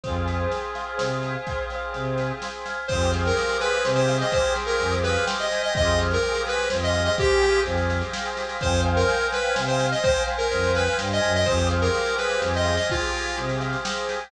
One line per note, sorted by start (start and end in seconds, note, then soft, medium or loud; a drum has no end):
0.04 0.47 F2 medium
0.04 1.32 C4 medium
0.04 1.32 F4 medium
0.04 1.32 G#4 medium
0.04 0.51 C5 medium
0.04 kick medium
0.04 snare medium
0.26 1.22 G#5 medium
0.26 snare medium
0.51 0.97 C5 medium
0.51 snare medium
0.75 1.47 F5 medium
0.75 snare medium
0.98 1.37 C3 soft
0.98 1.71 C5 medium
0.98 snare loud
1.23 2.17 G#5 medium
1.23 snare medium
1.46 2.75 C4 medium
1.46 2.75 F4 medium
1.46 2.75 G#4 medium
1.46 2.65 F5 medium
1.46 kick medium
1.46 snare medium
1.70 1.93 C5 medium
1.70 snare medium
1.93 2.32 C3 medium
1.93 2.43 C5 medium
1.93 snare medium
2.18 2.86 G#5 medium
2.18 snare medium
2.42 2.88 C5 medium
2.42 snare loud
2.66 2.88 F5 medium
2.66 snare medium
2.88 3.32 F2 medium
2.88 5.46 C4 medium
2.88 5.46 F4 medium
2.88 3.11 C5 medium
2.88 3.85 C5 medium
2.88 kick loud
2.88 snare medium
2.92 5.46 G4 medium
2.92 5.46 G#4 medium
3.01 snare medium
3.13 4.08 F5 medium
3.13 snare medium
3.25 3.58 A#4 medium
3.25 snare medium
3.36 4.33 G5 medium
3.36 snare medium
3.49 snare medium
3.61 3.83 B4 medium
3.61 4.55 G#5 medium
3.61 snare medium
3.73 snare medium
3.85 4.23 C3 medium
3.85 4.80 C5 medium
3.85 snare loud
3.95 4.17 C5 medium
3.95 snare medium
4.08 5.03 F5 medium
4.08 snare medium
4.21 4.32 D#5 medium
4.21 snare medium
4.32 4.53 C5 medium
4.32 5.26 G5 medium
4.32 kick loud
4.32 snare medium
4.44 snare medium
4.56 5.52 G#5 medium
4.56 snare medium
4.66 4.95 A#4 medium
4.66 snare medium
4.79 5.18 F2 medium
4.79 5.71 C5 medium
4.79 snare medium
4.92 snare medium
5.03 5.25 B4 medium
5.03 5.71 F5 medium
5.03 snare medium
5.15 snare medium
5.27 5.72 G5 medium
5.27 snare loud
5.40 5.62 D#5 medium
5.40 snare medium
5.51 5.75 G#5 medium
5.51 snare medium
5.62 5.74 D#5 medium
5.62 snare medium
5.74 6.18 F2 medium
5.74 6.17 C4 medium
5.74 6.17 F4 loud
5.74 6.17 G4 medium
5.74 6.71 C5 medium
5.74 5.99 D#5 medium
5.74 kick loud
5.74 snare medium
5.79 6.17 G#4 medium
5.87 snare medium
5.98 6.92 F5 medium
5.98 snare medium
6.11 6.42 A#4 medium
6.11 snare medium
6.22 6.65 C4 medium
6.22 6.65 F4 medium
6.22 6.65 G4 medium
6.22 7.16 G5 medium
6.22 snare medium
6.27 6.65 G#4 medium
6.35 snare medium
6.45 6.68 B4 medium
6.45 7.41 G#5 medium
6.45 snare medium
6.58 snare medium
6.70 7.09 F2 medium
6.70 7.13 C4 medium
6.70 7.13 F4 medium
6.70 7.13 G4 medium
6.70 7.66 C5 medium
6.70 snare loud
6.75 7.13 G#4 medium
6.82 7.03 D#5 medium
6.82 snare medium
6.93 7.90 F5 medium
6.93 snare medium
7.04 7.16 D#5 medium
7.04 snare medium
7.17 7.61 C4 medium
7.17 7.61 F4 medium
7.17 7.61 G4 loud
7.17 8.12 G5 medium
7.17 kick loud
7.17 snare medium
7.21 7.61 G4 medium
7.21 7.61 G#4 medium
7.30 snare medium
7.41 8.38 G#5 medium
7.41 snare medium
7.54 snare medium
7.64 8.03 F2 medium
7.64 8.07 C4 medium
7.64 8.07 F4 medium
7.64 8.07 G4 medium
7.64 8.58 C5 medium
7.64 snare medium
7.69 8.07 G#4 medium
7.78 snare medium
7.90 8.59 F5 medium
7.90 snare medium
8.02 snare medium
8.13 8.57 C4 medium
8.13 8.57 F4 medium
8.13 8.58 G5 medium
8.13 snare loud
8.17 8.57 G4 medium
8.17 8.57 G#4 medium
8.25 snare medium
8.37 8.61 G#5 medium
8.37 snare medium
8.49 snare medium
8.61 9.04 F2 medium
8.61 9.89 C5 medium
8.61 9.54 C5 loud
8.61 8.81 C5 loud
8.61 9.89 F5 loud
8.61 9.89 G5 medium
8.61 kick loud
8.61 snare medium
8.66 9.89 G#5 medium
8.73 snare medium
8.85 9.78 F5 medium
8.85 snare medium
8.96 9.27 A#4 medium
8.96 snare medium
9.08 10.04 G5 medium
9.08 snare medium
9.21 snare medium
9.32 9.54 B4 medium
9.32 10.28 G#5 medium
9.32 snare medium
9.44 snare medium
9.55 9.94 C3 medium
9.55 10.51 C5 medium
9.55 snare loud
9.67 9.87 C5 medium
9.67 snare medium
9.79 10.74 F5 medium
9.79 snare medium
9.92 10.03 D#5 medium
9.92 snare medium
10.03 10.23 C5 loud
10.03 11.32 C5 medium
10.03 11.32 F5 medium
10.03 10.99 G5 medium
10.03 11.32 G5 medium
10.03 kick loud
10.03 snare medium
10.09 11.32 G#5 medium
10.16 snare medium
10.27 11.21 G#5 medium
10.27 snare medium
10.38 10.72 A#4 medium
10.38 snare medium
10.51 10.89 F2 medium
10.51 11.42 C5 medium
10.51 snare medium
10.63 snare medium
10.75 10.97 B4 medium
10.75 11.42 F5 medium
10.75 snare medium
10.87 snare medium
10.98 11.20 G2 medium
10.98 11.45 G5 medium
10.98 snare loud
11.11 11.33 D#5 medium
11.11 snare medium
11.21 11.45 F#2 medium
11.21 11.44 G#5 medium
11.21 snare medium
11.35 11.47 D#5 medium
11.35 snare medium
11.45 11.89 F2 medium
11.45 12.75 C4 medium
11.45 12.75 F4 medium
11.45 11.68 C5 medium
11.45 12.42 C5 loud
11.45 kick medium
11.45 snare medium
11.50 12.75 G4 medium
11.50 12.75 G#4 medium
11.58 snare medium
11.70 12.64 F5 medium
11.70 snare medium
11.81 12.15 A#4 medium
11.81 snare medium
11.94 12.89 G5 medium
11.94 snare medium
12.06 snare medium
12.17 12.41 B4 medium
12.17 13.13 G#5 medium
12.17 snare medium
12.30 snare medium
12.41 12.79 F2 medium
12.41 13.38 C5 medium
12.41 snare loud
12.54 12.76 D#5 medium
12.54 snare medium
12.65 13.59 F5 medium
12.65 snare medium
12.76 12.88 D#5 medium
12.76 snare medium
12.89 14.18 C4 medium
12.89 13.36 F4 medium
12.89 14.18 F4 medium
12.89 14.18 G4 medium
12.89 13.85 G5 medium
12.89 kick loud
12.89 snare medium
12.95 14.18 G#4 medium
13.02 snare medium
13.13 14.09 G#5 medium
13.13 snare medium
13.25 snare medium
13.37 13.76 C3 medium
13.37 14.29 C5 medium
13.37 snare medium
13.49 snare medium
13.60 14.28 F5 medium
13.60 snare medium
13.73 snare medium
13.85 14.30 G5 medium
13.85 snare loud
13.97 snare medium
14.09 14.31 G#5 medium
14.09 snare medium
14.20 snare medium